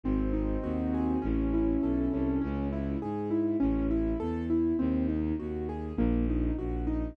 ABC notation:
X:1
M:4/4
L:1/8
Q:1/4=101
K:C#m
V:1 name="Acoustic Grand Piano"
^B, D F G C E A C | C E G E C E A E | ^B, D F G ^A, D F D |]
V:2 name="Violin" clef=bass
G,,,2 D,,2 A,,,2 B,,, ^B,,, | C,,2 G,,2 A,,,2 E,,2 | D,,2 D,,2 ^A,,,2 A,,,2 |]